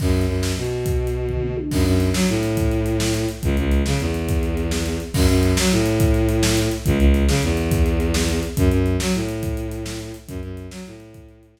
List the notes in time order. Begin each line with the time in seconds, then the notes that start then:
0.00 F#2, kick, crash
0.21 closed hi-hat
0.28 F#2
0.43 snare
0.57 B2
0.64 closed hi-hat
0.86 kick, closed hi-hat
1.07 closed hi-hat
1.28 kick, floor tom
1.43 mid tom
1.57 high tom
1.71 F#2, kick, crash
1.86 F#2, closed hi-hat
2.00 closed hi-hat
2.14 F#3, snare
2.28 A2, closed hi-hat
2.43 closed hi-hat
2.57 kick, closed hi-hat
2.71 closed hi-hat
2.86 closed hi-hat
3.00 snare
3.14 closed hi-hat
3.29 closed hi-hat
3.43 C#2, kick, closed hi-hat
3.57 C#2, closed hi-hat
3.71 closed hi-hat
3.86 C#3, snare
4.00 E2, closed hi-hat
4.14 closed hi-hat
4.29 kick, closed hi-hat
4.43 closed hi-hat
4.57 closed hi-hat
4.71 snare
4.86 closed hi-hat
5.00 closed hi-hat
5.14 F#2, kick, crash
5.29 F#2, closed hi-hat
5.43 closed hi-hat
5.57 F#3, snare
5.71 A2, closed hi-hat
5.86 closed hi-hat
6.00 kick, closed hi-hat
6.14 closed hi-hat
6.29 closed hi-hat
6.43 snare
6.57 closed hi-hat
6.71 closed hi-hat
6.86 C#2, kick, closed hi-hat
6.99 C#2, closed hi-hat
7.14 closed hi-hat
7.28 C#3, snare
7.43 E2, closed hi-hat
7.57 closed hi-hat
7.71 kick, closed hi-hat
7.86 closed hi-hat
8.00 closed hi-hat
8.14 snare
8.29 closed hi-hat
8.43 closed hi-hat
8.57 F#2, kick, closed hi-hat
8.71 F#2, closed hi-hat
8.86 closed hi-hat
9.00 F#3, snare
9.14 A2, closed hi-hat
9.29 closed hi-hat
9.43 kick, closed hi-hat
9.57 closed hi-hat
9.71 closed hi-hat
9.86 snare
10.00 closed hi-hat
10.14 closed hi-hat
10.28 F#2, kick, closed hi-hat
10.43 F#2, closed hi-hat
10.57 closed hi-hat
10.71 F#3, snare
10.86 A2, closed hi-hat
11.00 closed hi-hat
11.14 kick, closed hi-hat
11.29 closed hi-hat
11.43 closed hi-hat
11.57 snare